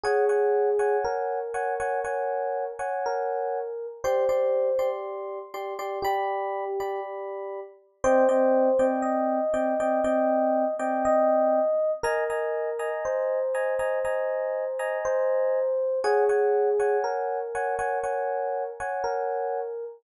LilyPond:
<<
  \new Staff \with { instrumentName = "Electric Piano 1" } { \time 4/4 \key c \minor \tempo 4 = 60 aes'4 bes'2 bes'4 | c''4 r4 g'4 r4 | c''4 ees''2 ees''4 | bes'4 c''2 c''4 |
aes'4 bes'2 bes'4 | }
  \new Staff \with { instrumentName = "Electric Piano 1" } { \time 4/4 \key c \minor <des'' ges'' aes''>16 <des'' ges'' aes''>8 <des'' ges'' aes''>8. <des'' ges'' aes''>16 <des'' ges'' aes''>16 <des'' ges'' aes''>8. <des'' ges'' aes''>4~ <des'' ges'' aes''>16 | <g' d'' c'''>16 <g' d'' c'''>8 <g' d'' c'''>8. <g' d'' c'''>16 <g' d'' c'''>16 <d'' b''>8. <g' d'' b''>4~ <g' d'' b''>16 | <c' d'' ees'' g''>16 <c' d'' ees'' g''>8 <c' d'' ees'' g''>8. <c' d'' ees'' g''>16 <c' d'' ees'' g''>16 <c' d'' ees'' g''>8. <c' d'' ees'' g''>4~ <c' d'' ees'' g''>16 | <ees'' aes'' bes''>16 <ees'' aes'' bes''>8 <ees'' aes'' bes''>8. <ees'' aes'' bes''>16 <ees'' aes'' bes''>16 <ees'' aes'' bes''>8. <ees'' aes'' bes''>4~ <ees'' aes'' bes''>16 |
<des'' ges'' aes''>16 <des'' ges'' aes''>8 <des'' ges'' aes''>8. <des'' ges'' aes''>16 <des'' ges'' aes''>16 <des'' ges'' aes''>8. <des'' ges'' aes''>4~ <des'' ges'' aes''>16 | }
>>